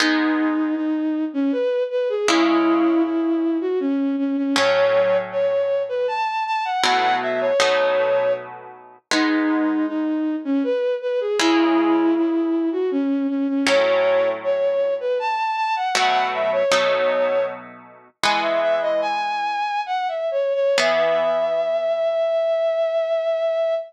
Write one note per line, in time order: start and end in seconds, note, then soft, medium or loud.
0.00 2.05 G#3 loud
0.00 2.05 B3 loud
0.00 0.74 D#4 loud
0.00 2.05 D#4 loud
0.76 1.24 D#4 medium
1.33 1.51 C#4 loud
1.52 1.83 B4 medium
1.90 2.08 B4 medium
2.09 2.27 G#4 medium
2.28 4.33 C#3 loud
2.28 4.33 G#3 loud
2.28 3.02 E4 loud
2.28 4.33 E4 loud
3.04 3.58 E4 medium
3.61 3.79 F#4 medium
3.80 4.15 C#4 loud
4.18 4.36 C#4 medium
4.37 4.55 C#4 medium
4.56 6.61 A2 loud
4.56 6.61 F#3 loud
4.56 6.61 C#4 loud
4.56 5.17 C#5 loud
5.32 5.82 C#5 medium
5.89 6.07 B4 medium
6.08 6.44 A5 medium
6.46 6.64 A5 loud
6.65 6.83 F#5 medium
6.83 7.52 B2 loud
6.83 7.52 F#3 loud
6.83 7.52 A3 loud
6.83 7.52 E4 loud
6.83 7.16 F#5 loud
7.21 7.39 E5 medium
7.41 8.32 C#5 loud
7.60 8.96 B2 loud
7.60 8.96 F#3 loud
7.60 8.96 A3 loud
7.60 8.96 D#4 loud
9.11 11.16 G#3 loud
9.11 11.16 B3 loud
9.11 11.16 D#4 loud
9.11 9.86 D#4 loud
9.87 10.35 D#4 medium
10.44 10.62 C#4 loud
10.63 10.94 B4 medium
11.01 11.19 B4 medium
11.20 11.38 G#4 medium
11.39 13.44 C#3 loud
11.39 13.44 G#3 loud
11.39 12.14 E4 loud
11.39 13.44 E4 loud
12.15 12.69 E4 medium
12.72 12.90 F#4 medium
12.91 13.27 C#4 loud
13.29 13.47 C#4 medium
13.48 13.66 C#4 medium
13.66 15.72 A2 loud
13.66 15.72 F#3 loud
13.66 15.72 C#4 loud
13.66 14.28 C#5 loud
14.43 14.93 C#5 medium
15.00 15.18 B4 medium
15.19 15.56 A5 medium
15.57 15.75 A5 loud
15.76 15.94 F#5 medium
15.95 16.63 B2 loud
15.95 16.63 F#3 loud
15.95 16.63 A3 loud
15.95 16.63 E4 loud
15.95 16.27 F#5 loud
16.33 16.51 E5 medium
16.52 17.44 C#5 loud
16.71 18.08 B2 loud
16.71 18.08 F#3 loud
16.71 18.08 A3 loud
16.71 18.08 D#4 loud
18.23 20.50 E3 loud
18.23 20.50 G#3 loud
18.23 20.50 B3 loud
18.23 18.41 G#5 medium
18.42 18.60 E5 medium
18.61 18.80 E5 loud
18.81 19.00 D#5 loud
19.01 19.81 G#5 loud
19.86 20.07 F#5 medium
20.08 20.29 E5 medium
20.31 20.53 C#5 medium
20.54 20.76 C#5 loud
20.77 23.74 E3 loud
20.77 23.74 B3 loud
20.77 23.74 G#4 loud
20.77 23.74 E5 loud